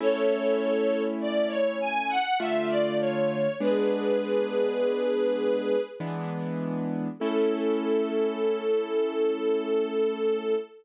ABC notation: X:1
M:3/4
L:1/16
Q:1/4=50
K:A
V:1 name="String Ensemble 1"
[Ac]4 d c g f e d c2 | [GB]8 z4 | A12 |]
V:2 name="Acoustic Grand Piano"
[A,CE]8 [D,A,=F]4 | [G,B,D]8 [E,G,B,D]4 | [A,CE]12 |]